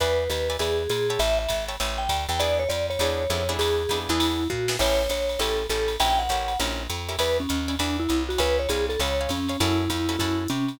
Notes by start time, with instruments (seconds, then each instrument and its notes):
0.00 electric bass (finger) E2, acoustic guitar (steel) B4 D5 E5 G#5, vibraphone B4, kick, ride
0.30 electric bass (finger) D#2, vibraphone B4, hi-hat pedal, ride
0.50 acoustic guitar (steel) B4 D5 E5 G#5, ride
0.59 electric bass (finger) E2, vibraphone G#4, acoustic guitar (steel) B4 D5 E5 G#5, ride
0.90 electric bass (finger) A#2, vibraphone G#4, hi-hat pedal, ride
1.10 acoustic guitar (steel) C#5 E5 G5 A5, ride
1.19 electric bass (finger) A1, vibraphone E5, ride
1.39 vibraphone E5
1.49 electric bass (finger) G#1, kick, hi-hat pedal, ride
1.69 acoustic guitar (steel) C#5 E5 G5 A5, ride
1.80 electric bass (finger) A1, acoustic guitar (steel) C#5 E5 G5 A5, ride
1.98 vibraphone G5
2.09 electric bass (finger) D2, kick, hi-hat pedal, ride
2.29 electric bass (finger) E2, vibraphone G5, ride
2.40 acoustic guitar (steel) B3 D4 E4 G#4, vibraphone D5, ride
2.60 vibraphone C#5
2.69 electric bass (finger) F2, vibraphone D5, hi-hat pedal, ride
2.90 vibraphone C#5, ride
2.99 electric bass (finger) E2, acoustic guitar (steel) B3 D4 E4 G#4, ride
3.30 electric bass (finger) F2, acoustic guitar (steel) B3 D4 E4 G#4, hi-hat pedal, ride
3.49 acoustic guitar (steel) B3 D4 E4 G#4, ride
3.59 electric bass (finger) E2, vibraphone G#4, ride
3.89 electric bass (finger) F2, acoustic guitar (steel) B3 D4 E4 G#4, kick, hi-hat pedal, ride
4.09 electric bass (finger) E2, acoustic guitar (steel) B3 D4 E4 G#4, vibraphone E4, ride
4.20 ride
4.50 electric bass (finger) A#2, vibraphone F#4, kick
4.68 acoustic guitar (steel) B3 D4 E4 G#4, snare
4.79 electric bass (finger) A1, acoustic guitar (steel) C#4 E4 G4 A4, vibraphone C#5, kick, crash, ride
5.09 electric bass (finger) A#1, vibraphone C#5, hi-hat pedal, ride
5.29 ride
5.39 electric bass (finger) A1, acoustic guitar (steel) C#4 E4 G4 A4, vibraphone A4, ride
5.69 electric bass (finger) A1, acoustic guitar (steel) C#4 E4 G4 A4, vibraphone A4, hi-hat pedal, ride
5.88 ride
6.00 electric bass (finger) A#1, acoustic guitar (steel) C#4 E4 G4 A#4, vibraphone G5, ride
6.19 vibraphone F#5
6.29 electric bass (finger) A1, acoustic guitar (steel) C#4 E4 G4 A#4, kick, hi-hat pedal, ride
6.48 ride
6.59 electric bass (finger) A#1, acoustic guitar (steel) C#4 E4 G4 A#4, ride
6.90 electric bass (finger) F2, hi-hat pedal, ride
7.09 acoustic guitar (steel) C#4 E4 G4 A#4, ride
7.19 electric bass (finger) E2, vibraphone B4, acoustic guitar (steel) D5 E5 G#5 B5, ride
7.40 vibraphone C#4
7.49 electric bass (finger) D#2, hi-hat pedal, ride
7.68 acoustic guitar (steel) D5 E5 G#5 B5, ride
7.79 electric bass (finger) E2, vibraphone D4, acoustic guitar (steel) D5 E5 G#5 B5, ride
8.00 vibraphone E4
8.09 electric bass (finger) C2, hi-hat pedal, ride
8.29 vibraphone F#4, ride
8.38 electric bass (finger) C#2, vibraphone B4, acoustic guitar (steel) C#5 F5 G#5 B5, kick, ride
8.59 vibraphone C#5
8.69 electric bass (finger) C2, vibraphone G#4, acoustic guitar (steel) C#5 F5 G#5 B5, kick, hi-hat pedal, ride
8.89 vibraphone A4, ride
9.00 electric bass (finger) C#2, acoustic guitar (steel) C#5 F5 G#5 B5, vibraphone C#5, ride
9.21 acoustic guitar (steel) C#5 F5 G#5 B5
9.29 electric bass (finger) F2, vibraphone C#4, kick, hi-hat pedal, ride
9.49 acoustic guitar (steel) C#5 F5 G#5 B5, ride
9.60 electric bass (finger) F#2, acoustic guitar (steel) C#4 E4 F#4 A4, vibraphone E4, kick, ride
9.90 electric bass (finger) F2, vibraphone E4, kick, hi-hat pedal, ride
10.09 acoustic guitar (steel) C#4 E4 F#4 A4, ride
10.19 electric bass (finger) F#2, acoustic guitar (steel) C#4 E4 F#4 A4, vibraphone E4, kick, ride
10.48 electric bass (finger) C3, vibraphone C#4, hi-hat pedal, ride
10.68 ride